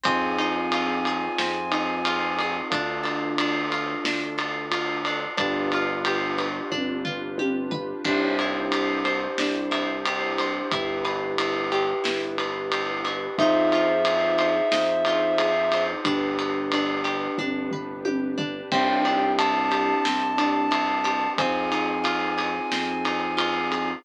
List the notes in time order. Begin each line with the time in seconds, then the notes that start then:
0.03 F2 C4 D#4 F4 G#4 G#5, kick, ride
0.38 D#4, ride
0.72 F4, ride
1.05 G#4, ride
1.38 F2 C4, snare
1.72 D#4, ride
2.05 F4, ride
2.39 G#4, ride
2.70 D2 D4 F4 A4, kick, ride
3.03 A4, ride
3.38 D4, ride
3.72 F4, ride
4.03 D2 D4, snare
4.38 A4, ride
4.72 F4, ride
5.05 D4, ride
5.37 G1 D4 F4 G4 B4, kick, ride
5.72 F4, ride
6.05 G4, ride
6.38 B4, ride
6.71 G1 D4, kick, high tom
7.05 F4, floor tom
7.38 G4, high tom
7.71 B4, floor tom
8.04 C2 D4 E4 G4 C5, kick, crash
8.39 E4, ride
8.72 G4, ride
9.05 C5, ride
9.38 C2 D4, snare
9.71 E4, ride
10.05 G4, ride
10.38 C5, ride
10.71 G1 E4 G4 B4, kick, ride
11.05 B4, ride
11.38 E4, ride
11.72 G4, ride
12.04 G1 E4, snare
12.38 B4, ride
12.72 G4, ride
13.04 E4, ride
13.38 F2 D#4 F4 G#4 C5 E5, kick, ride
13.72 F4, ride
14.05 G#4, ride
14.38 C5, ride
14.72 F2 D#4, snare
15.05 F4, ride
15.38 G#4, ride
15.72 C5, ride
16.04 G1 D4 G4 B4, kick, ride
16.39 B4, ride
16.72 D4, ride
17.04 G4, ride
17.38 G1 D4, kick, high tom
17.71 B4, floor tom
18.05 G4, high tom
18.38 D4, floor tom
18.71 C2 C4 D4 E4 G4 G5, kick, crash
19.05 D4, ride
19.38 E4 A5, ride
19.71 G4, ride
20.05 C2 C4, snare
20.38 D4, ride
20.71 E4, ride
21.04 G4, ride
21.37 F2 C4 D#4 F4 G#4 G#5, kick, ride
21.72 D#4, ride
22.04 F4, ride
22.38 G#4, ride
22.72 F2 C4, snare
23.05 D#4, ride
23.37 F4, ride
23.72 G#4, ride